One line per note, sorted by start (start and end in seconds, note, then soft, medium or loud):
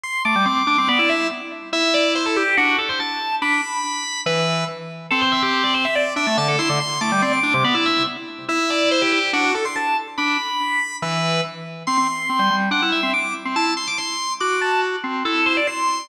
0.03 0.22 C6 loud
0.25 0.35 A3 medium
0.25 0.44 D6 medium
0.35 0.46 G3 medium
0.46 0.63 C4 medium
0.46 0.56 D6 medium
0.57 0.67 D6 medium
0.67 0.77 D4 loud
0.67 0.87 D6 medium
0.78 0.88 C4 medium
0.88 0.98 B3 loud
0.88 0.98 D5 loud
0.99 1.27 E4 medium
0.99 1.09 D5 medium
1.09 1.28 E5 medium
1.73 2.43 E4 loud
1.73 1.93 E5 loud
1.94 2.13 D5 medium
2.15 2.25 C5 medium
2.26 2.36 A4 medium
2.36 2.55 G4 medium
2.57 2.76 D4 loud
2.57 2.77 F#4 loud
2.78 2.88 A4 medium
2.89 2.99 C5 medium
3.00 3.35 A5 medium
3.42 3.61 D4 medium
3.42 4.20 B5 medium
4.26 4.64 E3 loud
4.26 4.64 B4 medium
5.11 5.86 C4 loud
5.11 5.21 A4 loud
5.21 5.31 C5 medium
5.32 5.42 E5 medium
5.43 5.63 G4 loud
5.64 5.74 D5 medium
5.74 5.84 C5 medium
5.85 5.95 E5 medium
5.95 6.13 D5 loud
6.16 6.26 D4 loud
6.16 6.36 E5 loud
6.27 6.37 A3 medium
6.37 6.56 D3 loud
6.37 6.48 A5 loud
6.48 6.58 A4 medium
6.59 6.69 E4 loud
6.59 6.78 C6 medium
6.69 6.79 D3 loud
6.80 6.99 C6 loud
7.01 7.11 A3 medium
7.01 7.21 D6 loud
7.12 7.22 G3 medium
7.22 7.40 C4 medium
7.22 7.32 D5 medium
7.33 7.43 D6 medium
7.43 7.53 D4 loud
7.43 7.63 D6 medium
7.54 7.64 C3 loud
7.64 7.74 B3 loud
7.64 7.74 D5 loud
7.74 8.03 E4 loud
7.74 7.85 D5 medium
7.86 8.04 E5 medium
8.49 9.19 E4 loud
8.49 8.69 E5 loud
8.70 8.89 D5 loud
8.91 9.01 C5 loud
9.02 9.11 G4 medium
9.12 9.31 G4 medium
9.33 9.52 D4 loud
9.33 9.53 F#4 loud
9.55 9.65 A4 medium
9.65 9.75 C6 medium
9.76 9.97 A5 medium
10.18 10.37 D4 medium
10.18 10.96 B5 loud
11.02 11.41 E3 loud
11.02 11.40 B4 medium
11.87 11.97 C4 medium
11.87 12.55 C6 medium
11.97 12.07 C4 medium
12.29 12.39 C4 medium
12.39 12.49 G3 medium
12.50 12.69 G3 medium
12.71 12.81 D4 medium
12.71 12.89 F#5 medium
12.82 13.01 E4 medium
12.92 13.11 E5 medium
13.03 13.13 C4 medium
13.13 13.33 D6 medium
13.45 13.55 C4 medium
13.56 13.74 E4 medium
13.56 13.73 A5 medium
13.77 13.87 C6 medium
13.87 13.97 D6 medium
13.98 14.33 C6 medium
14.40 14.96 F#4 medium
14.40 14.59 D6 medium
14.61 14.80 A5 medium
15.04 15.23 C4 medium
15.25 15.60 E4 medium
15.25 15.44 A4 medium
15.46 15.56 C5 medium
15.57 15.67 D5 medium
15.67 16.08 C6 medium